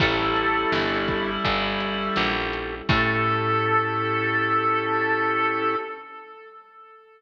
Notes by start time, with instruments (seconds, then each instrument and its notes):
0.00 electric bass (finger) A1, clarinet G3 E4, pad 2 (warm) C#4 E4 G4 A4, drawbar organ C#4 E4 G4 A4, harmonica A4, kick, crash
0.36 closed hi-hat
0.72 electric bass (finger) G1, snare
1.08 kick, closed hi-hat
1.44 electric bass (finger) G1, drawbar organ C#4 E4 G4 A4, kick, closed hi-hat
1.80 closed hi-hat
2.16 electric bass (finger) A#1, snare
2.53 closed hi-hat
2.88 electric bass (finger) A2, pad 2 (warm) C#4 E4 G4 A4, drawbar organ C#4 E4 G4 A4, harmonica A4, clarinet A4, kick, crash